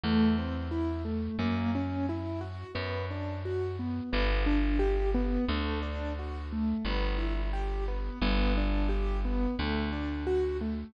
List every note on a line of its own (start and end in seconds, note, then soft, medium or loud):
0.04 1.29 E2 medium
0.04 0.35 A3 medium
0.38 0.69 C4 medium
0.71 1.02 E4 medium
1.05 1.36 A3 medium
1.39 2.64 F#2 medium
1.39 1.70 A#3 medium
1.75 2.06 C#4 medium
2.09 2.40 E4 medium
2.41 2.72 F#4 medium
2.75 4.01 F#2 medium
2.75 3.06 B3 medium
3.11 3.41 D4 medium
3.45 3.76 F#4 medium
3.79 4.10 B3 medium
4.13 5.38 G1 medium
4.13 4.43 B3 medium
4.46 4.77 D4 medium
4.79 5.10 G4 medium
5.14 5.45 B3 medium
5.48 6.74 D2 medium
5.48 5.80 A3 medium
5.83 6.13 D4 medium
6.19 6.50 F#4 medium
6.53 6.83 A3 medium
6.85 8.10 G1 medium
6.85 7.17 B3 medium
7.18 7.49 E4 medium
7.53 7.84 G4 medium
7.88 8.19 B3 medium
8.22 9.47 G1 medium
8.22 8.53 B3 medium
8.58 8.88 D4 medium
8.89 9.20 G4 medium
9.25 9.56 B3 medium
9.59 10.84 D2 medium
9.59 9.90 A3 medium
9.93 10.23 D4 medium
10.27 10.57 F#4 medium
10.61 10.92 A3 medium